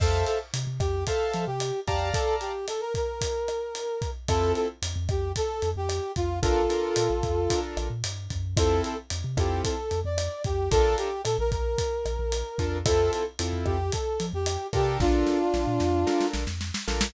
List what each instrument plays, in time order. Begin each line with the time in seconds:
0.00 synth bass 1 F2, brass section A4, acoustic grand piano C5 E5 F5 A5, kick, cross-stick, crash
0.26 brass section A4, closed hi-hat
0.53 synth bass 1 C3, closed hi-hat
0.67 synth bass 1 C3
0.79 synth bass 1 F2, brass section G4, kick, cross-stick, closed hi-hat
1.07 brass section A4, acoustic grand piano C5 E5 F5 A5, kick, closed hi-hat
1.33 synth bass 1 F3, closed hi-hat
1.47 synth bass 1 C3, brass section G4
1.60 cross-stick, closed hi-hat
1.87 synth bass 1 F2, brass section G4, acoustic grand piano D5 F5 A5 A#5, kick, closed hi-hat
2.13 brass section A4, kick, closed hi-hat
2.41 brass section G4, closed hi-hat
2.68 brass section A4, cross-stick, closed hi-hat
2.81 brass section A#4
2.94 brass section A#4, kick, closed hi-hat
3.21 kick, closed hi-hat
3.48 cross-stick, closed hi-hat
3.75 closed hi-hat
4.02 kick, closed hi-hat
4.28 synth bass 1 F2, acoustic grand piano C4 E4 F4 A4, brass section A4, kick, cross-stick, closed hi-hat
4.55 brass section A4, closed hi-hat
4.82 synth bass 1 F2, closed hi-hat
4.96 synth bass 1 F2
5.09 synth bass 1 F2, brass section G4, kick, cross-stick, closed hi-hat
5.36 brass section A4, kick, closed hi-hat
5.62 synth bass 1 F2, closed hi-hat
5.76 synth bass 1 F2, brass section G4
5.89 cross-stick, closed hi-hat
6.16 synth bass 1 F2, brass section F4, kick, closed hi-hat
6.42 synth bass 1 A#1, acoustic grand piano D4 F4 A4 A#4, brass section F4 A4, kick, closed hi-hat
6.70 acoustic grand piano D4 F4 A4 A#4, closed hi-hat
6.96 synth bass 1 A#2, cross-stick, closed hi-hat
7.10 synth bass 1 A#1
7.23 synth bass 1 F2, kick, closed hi-hat
7.50 acoustic grand piano D4 F4 A4 A#4, kick, closed hi-hat
7.77 synth bass 1 A#1, cross-stick, closed hi-hat
7.90 synth bass 1 A#2
8.04 synth bass 1 G2, closed hi-hat
8.30 synth bass 1 F#2, kick, closed hi-hat
8.57 synth bass 1 F2, acoustic grand piano C4 E4 F4 A4, brass section A4, kick, cross-stick, closed hi-hat
8.84 brass section A4, closed hi-hat
9.10 synth bass 1 F2, closed hi-hat
9.24 synth bass 1 C3
9.37 synth bass 1 F2, acoustic grand piano C4 E4 F4 A4, brass section G4, kick, cross-stick, closed hi-hat
9.64 brass section A4, kick, closed hi-hat
9.91 synth bass 1 F2, closed hi-hat
10.04 synth bass 1 F2, brass section D5
10.18 cross-stick, closed hi-hat
10.44 synth bass 1 F2, brass section G4, kick, closed hi-hat
10.71 synth bass 1 A#1, acoustic grand piano D4 F4 A4 A#4, brass section A4, kick, closed hi-hat
10.98 brass section G4, closed hi-hat
11.24 synth bass 1 A#2, brass section A4, cross-stick, closed hi-hat
11.38 synth bass 1 A#1, brass section A#4
11.51 synth bass 1 A#1, brass section A#4, kick, closed hi-hat
11.78 kick, closed hi-hat
12.05 synth bass 1 A#1, cross-stick, closed hi-hat
12.19 synth bass 1 A#1
12.32 closed hi-hat
12.58 synth bass 1 F2, acoustic grand piano D4 F4 A4 A#4, kick, closed hi-hat
12.86 synth bass 1 F2, acoustic grand piano C4 E4 F4 A4, brass section A4, kick, cross-stick, closed hi-hat
13.12 brass section A4, closed hi-hat
13.39 synth bass 1 F2, acoustic grand piano C4 E4 F4 A4, closed hi-hat
13.53 synth bass 1 F2
13.65 synth bass 1 F2, brass section G4, kick, cross-stick
13.92 brass section A4, kick, closed hi-hat
14.20 synth bass 1 F3, closed hi-hat
14.33 synth bass 1 F2, brass section G4
14.46 cross-stick, closed hi-hat
14.73 synth bass 1 C3, acoustic grand piano D4 F4 A4 A#4, brass section G4, kick, closed hi-hat
15.00 synth bass 1 A#1, brass section D4 F4, kick, snare
15.26 snare
15.54 synth bass 1 A#1, snare
15.67 synth bass 1 A#2
15.80 synth bass 1 F2, snare
16.07 acoustic grand piano D4 F4 A4 A#4, snare
16.21 snare
16.33 synth bass 1 A#1, snare
16.47 synth bass 1 F2, snare
16.61 snare
16.74 snare
16.87 synth bass 1 A#1, acoustic grand piano D4 F4 A4 A#4, snare
17.01 snare